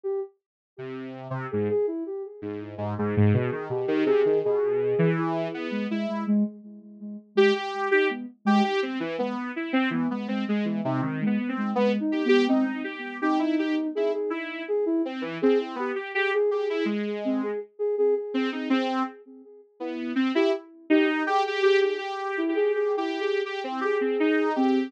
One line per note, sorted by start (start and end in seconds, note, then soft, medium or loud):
0.04 0.20 G4 medium
0.78 1.28 C3 medium
1.30 1.47 C3 medium
1.51 1.69 G#2 medium
1.51 1.68 G#4 medium
1.70 1.86 G#4 loud
1.87 2.04 E4 medium
2.06 2.23 G4 medium
2.42 2.75 G#2 medium
2.78 2.94 G#2 medium
2.98 3.15 G#2 loud
2.98 3.64 G#4 medium
3.17 3.33 G#2 loud
3.34 3.50 B2 loud
3.52 3.68 D#3 medium
3.69 3.86 B2 medium
3.69 4.03 G4 medium
3.88 4.04 D#3 loud
4.06 4.22 C3 loud
4.06 4.39 G#4 loud
4.25 4.42 D#3 medium
4.44 4.95 B2 medium
4.44 5.10 G#4 loud
4.99 5.48 E3 loud
5.18 5.67 E4 medium
5.54 5.87 B3 medium
5.71 5.87 G#3 medium
5.89 6.06 G#3 medium
5.89 6.24 E4 medium
6.08 6.25 G#3 medium
6.27 6.43 G#3 loud
7.35 7.52 G#3 medium
7.35 7.54 G4 loud
7.55 7.88 G4 medium
7.91 8.08 D#4 medium
7.91 8.08 G4 loud
8.10 8.26 B3 medium
8.45 8.61 G#3 loud
8.45 8.63 G4 loud
8.64 8.80 G4 medium
8.82 8.99 C4 medium
9.00 9.16 E3 medium
9.19 9.52 B3 medium
9.56 9.72 E4 medium
9.73 9.89 C4 loud
9.90 10.07 E3 medium
9.90 10.09 B3 loud
10.10 10.27 G#3 medium
10.10 10.27 B3 medium
10.28 10.45 G#3 medium
10.28 10.45 C4 medium
10.48 10.81 G#3 medium
10.48 10.65 G#3 medium
10.65 10.81 E3 soft
10.84 11.01 C3 loud
10.84 11.01 D#4 medium
11.02 11.24 D#3 medium
11.02 11.19 C4 medium
11.21 11.37 G#3 medium
11.26 11.48 B3 medium
11.39 11.55 B3 medium
11.49 11.71 C4 medium
11.57 11.73 G#3 medium
11.75 11.98 G#3 medium
11.75 11.92 B3 loud
12.00 12.22 D#4 medium
12.12 12.28 G4 medium
12.25 12.47 B3 loud
12.25 12.45 G4 loud
12.48 12.64 C4 loud
12.48 12.82 D#4 medium
12.67 12.83 C4 medium
12.84 13.17 G4 medium
13.21 13.87 D#4 loud
13.21 13.38 G4 medium
13.39 13.56 E4 medium
13.59 13.75 G4 medium
13.95 14.13 E4 medium
13.95 14.12 G#4 medium
14.13 14.30 G#4 medium
14.30 14.63 E4 medium
14.68 14.85 G#4 loud
14.86 15.02 E4 loud
15.05 15.22 C4 medium
15.21 15.38 E3 medium
15.42 15.75 C4 medium
15.42 15.58 G#4 loud
15.75 15.92 B3 medium
15.75 15.95 G4 medium
15.95 16.12 G4 medium
16.15 16.31 G4 loud
16.15 16.32 G#4 medium
16.34 16.50 G#4 loud
16.51 16.67 G4 medium
16.51 16.84 G#4 medium
16.70 16.86 E4 medium
16.85 17.51 G#3 medium
17.25 17.41 C4 medium
17.43 17.59 G#4 medium
17.79 17.95 G#4 medium
17.98 18.14 G#4 loud
18.16 18.49 G#4 medium
18.34 18.50 C4 medium
18.52 18.69 C4 medium
18.52 18.68 D#4 soft
18.70 19.03 C4 loud
19.80 20.13 B3 medium
19.80 20.13 E4 medium
20.15 20.32 C4 medium
20.35 20.51 E4 loud
20.35 20.52 G4 loud
20.90 21.23 D#4 loud
20.90 21.06 G4 loud
21.07 21.24 D#4 medium
21.27 21.43 G4 loud
21.27 21.61 G#4 medium
21.47 21.62 G4 medium
21.62 21.79 G4 loud
21.62 21.95 G#4 medium
21.81 21.97 G4 medium
21.98 22.42 G4 medium
22.37 22.54 E4 loud
22.48 22.92 G4 soft
22.55 22.72 G#4 loud
22.74 22.96 G#4 medium
22.97 23.19 E4 medium
22.97 23.41 G4 medium
23.20 23.42 G#4 medium
23.45 23.62 G4 medium
23.64 23.80 C4 medium
23.81 23.97 G4 medium
23.81 24.50 G#4 medium
24.01 24.17 C4 medium
24.20 24.53 D#4 medium
24.55 24.89 C4 loud
24.55 24.88 G4 medium